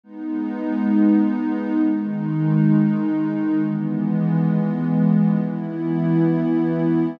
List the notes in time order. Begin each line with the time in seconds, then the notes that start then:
0.04 G#3 B3 D#4
1.84 D#3 G#3 D#4
3.62 E3 G#3 B3
5.41 E3 B3 E4